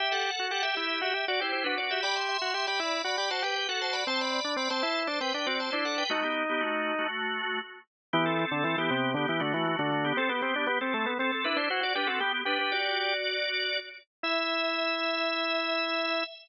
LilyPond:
<<
  \new Staff \with { instrumentName = "Drawbar Organ" } { \time 4/4 \key e \minor \tempo 4 = 118 <g' e''>16 <a' fis''>16 <a' fis''>8 <a' fis''>16 <g' e''>8. <g' e''>16 <g' e''>16 <fis' d''>16 <e' c''>16 <e' c''>16 <d' b'>16 <fis' d''>16 <g' e''>16 | <d'' b''>16 <e'' c'''>16 <e'' c'''>8 <e'' c'''>16 <d'' b''>8. <d'' b''>16 <d'' b''>16 <c'' a''>16 <b' g''>16 <b' g''>16 <a' fis''>16 <c'' a''>16 <d'' b''>16 | <c'' a''>16 <d'' b''>16 <d'' b''>8 <d'' b''>16 <c'' a''>8. <c'' a''>16 <b' g''>16 <b' g''>16 <fis' d''>16 <c'' a''>16 <e' c''>16 <a' fis''>16 <b' g''>16 | <a fis'>16 <b g'>8 <b g'>16 <a fis'>8. <a fis'>4~ <a fis'>16 r4 |
<b g'>16 <c' a'>16 <c' a'>8 <c' a'>16 <b g'>8. <b g'>16 <b g'>16 <a fis'>16 <a fis'>16 <a fis'>16 <a fis'>16 <a fis'>16 <b g'>16 | <c' a'>16 <b g'>16 <b g'>8 <b g'>16 <c' a'>8. <c' a'>16 <c' a'>16 <d' b'>16 <e' c''>16 <e' c''>16 <fis' d''>16 <d' b'>16 <c' a'>16 | <b g'>8 <d' b'>16 <d' b'>16 <fis' d''>2~ <fis' d''>8 r8 | e''1 | }
  \new Staff \with { instrumentName = "Drawbar Organ" } { \time 4/4 \key e \minor g'8. fis'16 g'16 g'16 e'8 fis'16 g'16 fis'16 g'8 fis'8. | g'8. fis'16 g'16 g'16 e'8 fis'16 g'16 fis'16 g'8 fis'8. | c'8. d'16 c'16 c'16 e'8 d'16 c'16 d'16 c'8 d'8. | dis'2 r2 |
e8. d16 e16 e16 c8 d16 e16 d16 e8 d8. | c'16 b16 c'16 d'16 b16 c'16 a16 b16 c'16 r16 e'16 d'16 fis'16 fis'16 g'16 fis'16 | g'16 r16 g'4. r2 | e'1 | }
>>